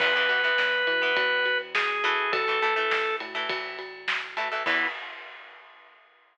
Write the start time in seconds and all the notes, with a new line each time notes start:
0.00 E2 E3 B3 B4, kick, crash
0.16 E3 B3
0.29 E3 B3, ride
0.44 E3 B3
0.58 E2, snare
0.87 E3, ride
1.02 E3 B3
1.16 E2, kick, ride
1.46 ride
1.75 G#4, snare
2.04 E3 A3, ride
2.32 A1 A4, kick, ride
2.48 E3 A3
2.62 E3 A3, ride
2.76 E3 A3
2.91 A1, snare
3.20 A2, ride
3.35 E3 A3
3.49 A1, kick, ride
3.79 ride
4.08 snare
4.37 E3 A3, ride
4.51 E3 A3
4.66 E2 E3 B3 E4, kick, crash